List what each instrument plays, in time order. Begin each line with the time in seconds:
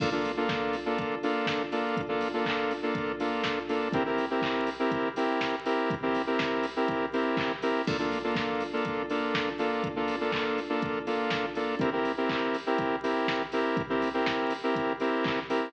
0.00 lead 2 (sawtooth) A#3 D4 F4 A4, kick, crash
0.12 lead 2 (sawtooth) A#3 D4 F4 A4
0.24 open hi-hat
0.37 lead 2 (sawtooth) A#3 D4 F4 A4
0.49 kick, snare
0.73 open hi-hat
0.86 lead 2 (sawtooth) A#3 D4 F4 A4
0.98 kick, closed hi-hat
1.23 lead 2 (sawtooth) A#3 D4 F4 A4, open hi-hat
1.47 kick, snare
1.72 lead 2 (sawtooth) A#3 D4 F4 A4, open hi-hat
1.97 kick, closed hi-hat
2.09 lead 2 (sawtooth) A#3 D4 F4 A4
2.21 open hi-hat
2.34 lead 2 (sawtooth) A#3 D4 F4 A4
2.46 kick, clap
2.71 open hi-hat
2.83 lead 2 (sawtooth) A#3 D4 F4 A4
2.95 kick, closed hi-hat
3.20 lead 2 (sawtooth) A#3 D4 F4 A4, open hi-hat
3.44 kick, snare
3.69 lead 2 (sawtooth) A#3 D4 F4 A4, open hi-hat
3.93 lead 2 (sawtooth) C4 E4 G4 A#4, kick, closed hi-hat
4.06 lead 2 (sawtooth) C4 E4 G4 A#4
4.18 open hi-hat
4.31 lead 2 (sawtooth) C4 E4 G4 A#4
4.42 kick, clap
4.67 open hi-hat
4.79 lead 2 (sawtooth) C4 E4 G4 A#4
4.91 kick, closed hi-hat
5.16 lead 2 (sawtooth) C4 E4 G4 A#4, open hi-hat
5.41 kick, snare
5.65 lead 2 (sawtooth) C4 E4 G4 A#4, open hi-hat
5.90 kick, closed hi-hat
6.02 lead 2 (sawtooth) C4 E4 G4 A#4
6.15 open hi-hat
6.27 lead 2 (sawtooth) C4 E4 G4 A#4
6.39 kick, snare
6.63 open hi-hat
6.76 lead 2 (sawtooth) C4 E4 G4 A#4
6.88 kick, closed hi-hat
7.13 lead 2 (sawtooth) C4 E4 G4 A#4, open hi-hat
7.37 kick, clap
7.62 lead 2 (sawtooth) C4 E4 G4 A#4, open hi-hat
7.87 lead 2 (sawtooth) A#3 D4 F4 A4, kick, crash
7.99 lead 2 (sawtooth) A#3 D4 F4 A4
8.12 open hi-hat
8.24 lead 2 (sawtooth) A#3 D4 F4 A4
8.35 kick, snare
8.61 open hi-hat
8.73 lead 2 (sawtooth) A#3 D4 F4 A4
8.85 kick, closed hi-hat
9.10 lead 2 (sawtooth) A#3 D4 F4 A4, open hi-hat
9.35 kick, snare
9.59 lead 2 (sawtooth) A#3 D4 F4 A4, open hi-hat
9.84 kick, closed hi-hat
9.96 lead 2 (sawtooth) A#3 D4 F4 A4
10.08 open hi-hat
10.21 lead 2 (sawtooth) A#3 D4 F4 A4
10.32 kick, clap
10.58 open hi-hat
10.69 lead 2 (sawtooth) A#3 D4 F4 A4
10.82 kick, closed hi-hat
11.07 lead 2 (sawtooth) A#3 D4 F4 A4, open hi-hat
11.30 kick, snare
11.55 lead 2 (sawtooth) A#3 D4 F4 A4, open hi-hat
11.80 lead 2 (sawtooth) C4 E4 G4 A#4, kick, closed hi-hat
11.93 lead 2 (sawtooth) C4 E4 G4 A#4
12.05 open hi-hat
12.17 lead 2 (sawtooth) C4 E4 G4 A#4
12.29 kick, clap
12.54 open hi-hat
12.66 lead 2 (sawtooth) C4 E4 G4 A#4
12.78 kick, closed hi-hat
13.03 lead 2 (sawtooth) C4 E4 G4 A#4, open hi-hat
13.28 kick, snare
13.52 lead 2 (sawtooth) C4 E4 G4 A#4, open hi-hat
13.77 kick, closed hi-hat
13.90 lead 2 (sawtooth) C4 E4 G4 A#4
14.02 open hi-hat
14.14 lead 2 (sawtooth) C4 E4 G4 A#4
14.26 kick, snare
14.51 open hi-hat
14.63 lead 2 (sawtooth) C4 E4 G4 A#4
14.76 kick, closed hi-hat
15.00 lead 2 (sawtooth) C4 E4 G4 A#4, open hi-hat
15.24 kick, clap
15.49 lead 2 (sawtooth) C4 E4 G4 A#4, open hi-hat